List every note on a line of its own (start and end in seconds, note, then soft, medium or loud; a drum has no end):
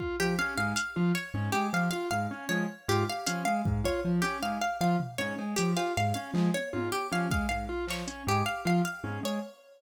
0.00 0.15 F4 medium
0.00 kick medium
0.20 0.35 F3 medium
0.20 0.35 G4 medium
0.39 0.54 C#4 medium
0.39 0.54 F5 medium
0.58 0.73 G#2 medium
0.58 0.73 G#3 medium
0.58 0.73 F5 medium
0.76 0.91 F5 medium
0.76 closed hi-hat loud
0.96 1.12 F3 medium
0.96 1.12 F4 medium
1.15 1.30 C#5 medium
1.34 1.49 G#2 medium
1.34 1.50 C#4 medium
1.52 1.69 G#3 medium
1.52 1.68 G4 medium
1.73 1.88 F3 medium
1.73 1.89 F5 medium
1.73 cowbell medium
1.91 2.08 F4 medium
1.91 2.06 F5 medium
2.11 2.27 G#2 medium
2.11 2.26 F5 medium
2.31 2.46 C#4 medium
2.49 2.64 F3 medium
2.49 2.65 G#3 medium
2.49 2.64 C#5 medium
2.88 3.04 G#2 medium
2.88 3.04 F4 medium
2.88 3.04 G4 medium
3.09 3.25 F5 medium
3.26 3.43 F3 medium
3.26 3.42 C#4 medium
3.26 3.42 F5 medium
3.26 closed hi-hat loud
3.45 3.62 G#3 medium
3.45 3.60 F5 medium
3.65 3.81 G#2 medium
3.65 kick loud
3.84 4.00 F4 medium
3.84 4.01 C#5 medium
3.84 kick medium
4.05 4.20 F3 medium
4.22 4.38 C#4 medium
4.22 4.37 G4 medium
4.42 4.58 G#2 medium
4.42 4.58 G#3 medium
4.42 4.58 F5 medium
4.61 4.77 F5 medium
4.81 4.96 F3 medium
4.81 4.96 F4 medium
4.81 4.96 F5 medium
5.00 floor tom loud
5.18 5.34 G#2 medium
5.18 5.34 C#4 medium
5.18 5.34 C#5 medium
5.38 5.54 G#3 medium
5.38 cowbell medium
5.56 5.74 F3 medium
5.56 5.72 G4 medium
5.56 closed hi-hat loud
5.77 5.92 F4 medium
5.77 5.92 F5 medium
5.77 cowbell loud
5.97 6.13 G#2 medium
5.97 6.13 F5 medium
6.14 6.31 C#4 medium
6.14 6.29 F5 medium
6.34 6.49 F3 medium
6.34 6.50 G#3 medium
6.34 clap medium
6.54 6.70 C#5 medium
6.54 high tom medium
6.73 6.89 G#2 medium
6.73 6.88 F4 medium
6.73 high tom medium
6.92 7.07 G4 medium
7.12 7.27 F3 medium
7.12 7.27 C#4 medium
7.12 7.28 F5 medium
7.31 7.46 G#3 medium
7.31 7.47 F5 medium
7.31 kick loud
7.49 7.66 G#2 medium
7.49 7.64 F5 medium
7.69 7.84 F4 medium
7.87 8.03 F3 medium
7.87 8.06 C#5 medium
7.87 clap medium
8.07 8.23 C#4 medium
8.07 closed hi-hat medium
8.27 8.43 G#2 medium
8.27 8.42 G#3 medium
8.27 8.44 G4 medium
8.46 8.61 F5 medium
8.65 8.81 F3 medium
8.65 8.81 F4 medium
8.65 8.82 F5 medium
8.85 9.00 F5 medium
9.04 9.19 G#2 medium
9.04 9.19 C#4 medium
9.04 high tom medium
9.23 9.38 G#3 medium
9.23 9.41 C#5 medium